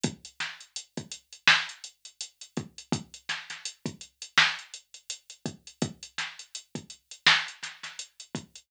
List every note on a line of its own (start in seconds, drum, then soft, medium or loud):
0.04 kick loud
0.04 closed hi-hat loud
0.25 closed hi-hat medium
0.40 snare medium
0.40 closed hi-hat medium
0.61 closed hi-hat medium
0.76 closed hi-hat medium
0.97 kick medium
0.97 closed hi-hat medium
1.12 closed hi-hat medium
1.33 closed hi-hat medium
1.47 snare loud
1.69 closed hi-hat medium
1.84 closed hi-hat medium
2.05 closed hi-hat medium
2.21 closed hi-hat medium
2.41 closed hi-hat medium
2.57 kick medium
2.57 closed hi-hat medium
2.78 closed hi-hat medium
2.92 kick loud
2.92 closed hi-hat medium
3.14 closed hi-hat medium
3.29 snare medium
3.29 closed hi-hat medium
3.50 snare soft
3.50 closed hi-hat medium
3.65 closed hi-hat medium
3.86 kick medium
3.86 closed hi-hat medium
4.01 closed hi-hat medium
4.22 closed hi-hat medium
4.38 snare medium
4.59 closed hi-hat medium
4.74 closed hi-hat medium
4.94 closed hi-hat medium
5.10 closed hi-hat loud
5.30 closed hi-hat medium
5.46 kick medium
5.46 closed hi-hat medium
5.67 closed hi-hat medium
5.82 kick loud
5.82 closed hi-hat medium
6.03 closed hi-hat medium
6.18 snare medium
6.18 closed hi-hat medium
6.39 closed hi-hat medium
6.55 closed hi-hat medium
6.75 kick medium
6.75 closed hi-hat medium
6.90 closed hi-hat medium
7.11 closed hi-hat medium
7.27 snare loud
7.48 closed hi-hat medium
7.63 snare soft
7.63 closed hi-hat medium
7.83 snare soft
7.83 closed hi-hat medium
7.99 closed hi-hat medium
8.20 closed hi-hat medium
8.35 kick medium
8.35 closed hi-hat medium
8.56 closed hi-hat medium